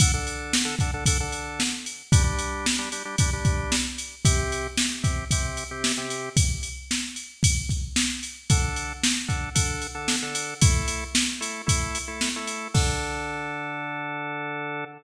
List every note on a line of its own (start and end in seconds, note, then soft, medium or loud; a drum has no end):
0.00 0.12 D3 loud
0.00 0.12 D4 medium
0.00 0.12 A4 loud
0.00 kick loud
0.00 ride loud
0.14 0.56 D3 medium
0.14 0.56 D4 medium
0.14 0.56 A4 medium
0.27 ride medium
0.53 snare loud
0.65 0.75 D3 medium
0.65 0.75 D4 medium
0.65 0.75 A4 medium
0.79 0.91 D3 medium
0.79 0.91 D4 medium
0.79 0.91 A4 medium
0.79 kick medium
0.79 ride medium
0.94 1.04 D3 medium
0.94 1.04 D4 loud
0.94 1.04 A4 medium
1.06 1.18 D3 medium
1.06 1.18 D4 loud
1.06 1.18 A4 medium
1.06 kick loud
1.06 ride loud
1.20 1.63 D3 medium
1.20 1.63 D4 medium
1.20 1.63 A4 medium
1.32 ride medium
1.60 snare loud
1.86 ride medium
2.12 2.23 G3 loud
2.12 2.23 D4 loud
2.12 2.23 G4 loud
2.12 kick loud
2.12 ride loud
2.24 2.66 G3 medium
2.24 2.66 D4 medium
2.24 2.66 G4 medium
2.39 ride medium
2.66 snare loud
2.79 2.89 G3 medium
2.79 2.89 D4 medium
2.79 2.89 G4 medium
2.92 3.03 G3 medium
2.92 3.03 D4 medium
2.92 3.03 G4 medium
2.92 ride medium
3.05 3.16 G3 medium
3.05 3.16 D4 medium
3.05 3.16 G4 medium
3.18 3.30 G3 medium
3.18 3.30 D4 medium
3.18 3.30 G4 medium
3.18 kick loud
3.18 ride loud
3.33 3.76 G3 medium
3.33 3.76 D4 medium
3.33 3.76 G4 medium
3.45 kick loud
3.45 ride medium
3.72 snare loud
3.98 ride medium
4.25 4.67 C3 loud
4.25 4.67 C4 loud
4.25 4.67 G4 loud
4.25 kick loud
4.25 ride loud
4.52 ride medium
4.77 snare loud
5.03 5.25 C3 medium
5.03 5.25 C4 medium
5.03 5.25 G4 medium
5.03 kick loud
5.03 ride medium
5.31 5.64 C3 loud
5.31 5.64 C4 medium
5.31 5.64 G4 medium
5.31 kick medium
5.31 ride loud
5.57 ride medium
5.71 5.92 C3 medium
5.71 5.92 C4 medium
5.71 5.92 G4 medium
5.84 snare loud
5.98 6.29 C3 medium
5.98 6.29 C4 medium
5.98 6.29 G4 medium
6.10 ride medium
6.37 kick loud
6.37 ride loud
6.63 ride medium
6.91 snare loud
7.16 ride medium
7.43 kick loud
7.43 ride loud
7.69 kick medium
7.69 ride medium
7.96 snare loud
8.23 ride medium
8.50 8.93 D3 medium
8.50 8.93 D4 medium
8.50 8.93 A4 loud
8.50 kick loud
8.50 ride loud
8.76 ride medium
9.03 snare loud
9.28 9.49 D3 medium
9.28 9.49 D4 medium
9.28 9.49 A4 medium
9.28 kick medium
9.28 ride medium
9.55 9.87 D3 medium
9.55 9.87 D4 medium
9.55 9.87 A4 medium
9.55 kick medium
9.55 ride loud
9.82 ride medium
9.95 10.16 D3 medium
9.95 10.16 D4 medium
9.95 10.16 A4 medium
10.08 snare loud
10.22 10.54 D3 medium
10.22 10.54 D4 medium
10.22 10.54 A4 medium
10.35 ride loud
10.62 11.04 A3 medium
10.62 11.04 E4 medium
10.62 11.04 A4 loud
10.62 kick loud
10.62 ride loud
10.88 ride medium
11.15 snare loud
11.40 11.62 A3 medium
11.40 11.62 E4 medium
11.40 11.62 A4 medium
11.40 ride medium
11.66 11.98 A3 medium
11.66 11.98 E4 loud
11.66 11.98 A4 medium
11.66 kick loud
11.66 ride loud
11.95 ride medium
12.08 12.29 A3 medium
12.08 12.29 E4 medium
12.08 12.29 A4 medium
12.21 snare loud
12.36 12.68 A3 medium
12.36 12.68 E4 medium
12.36 12.68 A4 medium
12.47 ride medium
12.74 14.85 D3 loud
12.74 14.85 D4 loud
12.74 14.85 A4 loud
12.74 kick loud
12.74 crash loud